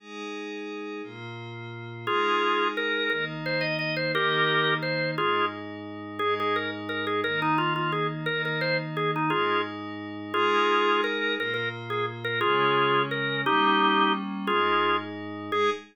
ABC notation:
X:1
M:6/8
L:1/8
Q:3/8=116
K:Ab
V:1 name="Drawbar Organ"
z6 | z6 | [FA]4 B2 | B z c e e c |
[GB]4 c2 | [FA]2 z4 | A A B z B A | B E F F A z |
B B c z A E | [FA]2 z4 | [FA]4 B2 | B B z A z B |
[FA]4 B2 | [EG]4 z2 | [FA]3 z3 | A3 z3 |]
V:2 name="Pad 5 (bowed)"
[A,EA]6 | [B,,B,F]6 | [A,EA]6 | [E,B,E]6 |
[E,B,E]6 | [A,,A,E]6 | [A,,A,E]6 | [E,B,E]6 |
[E,B,E]6 | [A,,A,E]6 | [A,EA]6 | [B,,B,F]6 |
[D,A,D]6 | [G,B,D]6 | [A,,A,E]6 | [A,EA]3 z3 |]